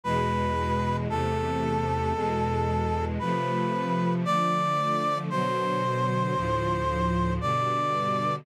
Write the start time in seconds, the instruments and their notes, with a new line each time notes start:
0.04 string ensemble 1 E2 B2 G#3, brass section B4
1.08 string ensemble 1 E2 C3 A3, brass section A4
2.14 string ensemble 1 E2 B2 G#3
3.19 string ensemble 1 C3 F3 A3, brass section B4
4.25 string ensemble 1 D3 F3 A3, brass section D5
5.30 string ensemble 1 B2 D3 F#3, brass section C5
6.35 string ensemble 1 D2 A2 F3
7.41 string ensemble 1 G2 B2 D3, brass section D5